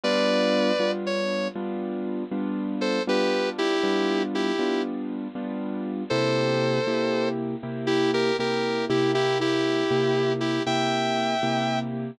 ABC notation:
X:1
M:12/8
L:1/8
Q:3/8=79
K:G
V:1 name="Distortion Guitar"
[Bd]4 _d2 z5 [Ac] | [GB]2 [EG]3 [EG]2 z5 | [Ac]5 z2 [EG] [G_B] [GB]2 [EG] | [EG] [EG]4 [EG] [eg]5 z |]
V:2 name="Acoustic Grand Piano"
[G,B,D=F]3 [G,B,DF]3 [G,B,DF]3 [G,B,DF]3 | [G,B,D=F]3 [G,B,DF]3 [G,B,DF]3 [G,B,DF]3 | [C,_B,EG]3 [C,B,EG]3 [C,B,EG]3 [C,B,EG]2 [C,B,EG]- | [C,_B,EG]3 [C,B,EG]3 [C,B,EG]3 [C,B,EG]3 |]